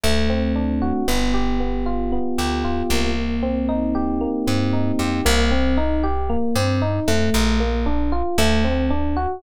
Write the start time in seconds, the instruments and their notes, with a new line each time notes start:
0.03 electric bass (finger) D2, electric piano 1 A3
0.30 electric piano 1 C4
0.56 electric piano 1 D4
0.82 electric piano 1 F#4
1.08 electric bass (finger) G1, electric piano 1 B3
1.34 electric piano 1 G4
1.60 electric piano 1 B3
1.86 electric piano 1 F4
2.12 electric piano 1 B3
2.38 electric bass (finger) D2, electric piano 1 G4
2.64 electric piano 1 F4
2.90 electric bass (finger) C2, electric piano 1 A#3
3.43 electric piano 1 C4
3.69 electric piano 1 D#4
3.95 electric piano 1 G4
4.21 electric piano 1 A#3
4.47 electric bass (finger) G2, electric piano 1 C4
4.73 electric piano 1 D#4
4.99 electric bass (finger) F2, electric piano 1 G4
5.25 electric bass (finger) C2, electric piano 1 A#3
5.51 electric piano 1 C4
5.77 electric piano 1 D#4
6.03 electric piano 1 G4
6.30 electric piano 1 A#3
6.55 electric bass (finger) G2, electric piano 1 C4
6.82 electric piano 1 D#4
7.08 electric bass (finger) F2, electric piano 1 A3
7.34 electric bass (finger) A#1
7.60 electric piano 1 A#3
7.86 electric piano 1 D4
8.12 electric piano 1 F4
8.38 electric bass (finger) D2, electric piano 1 A3
8.64 electric piano 1 C4
8.90 electric piano 1 D4
9.17 electric piano 1 F#4